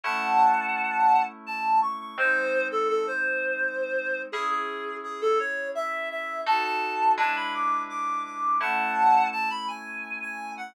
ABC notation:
X:1
M:3/4
L:1/16
Q:1/4=84
K:C#m
V:1 name="Clarinet"
[fa]8 a2 c' c' | ^B3 A A B7 | G G3 G A c2 e2 e2 | a a3 a b =d'2 d'2 d'2 |
[fa]4 a b g3 g2 f |]
V:2 name="Electric Piano 2"
[A,CE]12 | [G,^B,D]12 | [CEG]12 | [DFA]4 [G,=DEB]8 |
[A,CE]12 |]